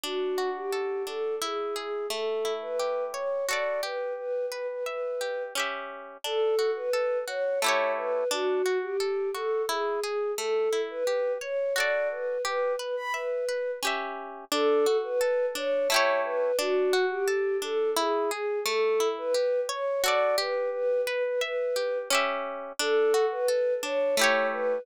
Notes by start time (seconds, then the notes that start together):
0.03 D4 F#4
0.38 F#4
0.56 G4
0.72 A4
1.07 D4 A4
1.42 E4 G#4
1.76 G#4
2.10 A3 A4
2.45 E4
2.62 B4
2.79 G4
3.13 C#5
3.48 F#4 A4 D5
3.53 D5
3.83 G4 B4
4.17 B4
4.51 B4
4.68 B4
4.86 B4 E5
5.21 G4
5.55 C#4 G4
5.59 E5
6.24 D4 A4
6.59 F#4
6.76 B4
6.93 A4
7.27 F#4 C#5
7.62 A3 E4 C#5
7.66 G4 C#5
7.97 B4
8.31 D4 F#4
8.66 F#4
8.82 G4
9.00 A4
9.34 F#4 A4
9.69 E4 G#4
10.03 G#4
10.38 A3 A4
10.73 E4
10.90 B4
11.07 G4
11.41 C#5
11.76 F#4 A4 D5
11.80 D5
12.11 B4
12.44 G4 B4
12.79 B4
12.96 B5
13.14 B4 E5
13.49 B4
13.83 C#4 G4
13.87 E5
14.52 D4 A4
14.86 F#4
15.03 B4
15.21 A4
15.55 D4 C#5
15.90 A3 E4 C#5
15.94 G4 C#5
16.25 B4
16.58 D4 F#4
16.93 F#4
17.10 G4
17.27 A4
17.62 D4 A4
17.96 E4 G#4
18.30 G#4
18.65 A3 A4
19.00 E4
19.18 B4
19.34 G4
19.69 C#5
20.04 F#4 A4 D5
20.08 D5
20.38 G4 B4
20.73 B4
21.07 B4
21.24 B4
21.41 B4 E5
21.76 G4
22.10 C#4 G4
22.15 E5
22.79 D4 A4
23.14 F#4
23.31 B4
23.48 A4
23.83 D4 C#5
24.17 A3 E4 C#5
24.21 G4 C#5
24.52 B4